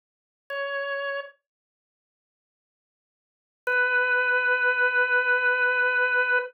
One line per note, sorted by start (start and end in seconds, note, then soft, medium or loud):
0.50 1.20 C#5 medium
3.67 6.39 B4 loud